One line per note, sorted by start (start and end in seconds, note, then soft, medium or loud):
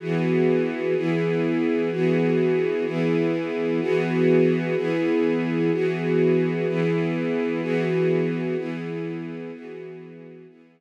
0.00 0.94 E3 medium
0.00 0.94 B3 medium
0.00 0.94 F#4 medium
0.00 0.94 G#4 medium
0.96 1.90 E3 medium
0.96 1.90 B3 medium
0.96 1.90 E4 medium
0.96 1.90 G#4 medium
1.91 2.85 E3 medium
1.91 2.85 B3 medium
1.91 2.85 F#4 medium
1.91 2.85 G#4 medium
2.86 3.80 E3 medium
2.86 3.80 B3 medium
2.86 3.80 E4 loud
2.86 3.80 G#4 medium
3.80 4.75 E3 medium
3.80 4.75 B3 loud
3.80 4.75 F#4 loud
3.80 4.75 G#4 medium
4.76 5.71 E3 medium
4.76 5.71 B3 medium
4.76 5.71 E4 loud
4.76 5.71 G#4 loud
5.72 6.66 E3 medium
5.72 6.66 B3 medium
5.72 6.66 F#4 medium
5.72 6.66 G#4 medium
6.67 7.61 E3 medium
6.67 7.61 B3 medium
6.67 7.61 E4 medium
6.67 7.61 G#4 medium
7.62 8.56 E3 loud
7.62 8.56 B3 medium
7.62 8.56 F#4 loud
7.62 8.56 G#4 medium
8.57 9.51 E3 medium
8.57 9.51 B3 medium
8.57 9.51 E4 medium
8.57 9.51 G#4 medium
9.52 10.46 E3 medium
9.52 10.46 B3 medium
9.52 10.46 F#4 medium
9.52 10.46 G#4 medium
10.48 10.80 E3 medium
10.48 10.80 B3 medium
10.48 10.80 E4 loud
10.48 10.80 G#4 medium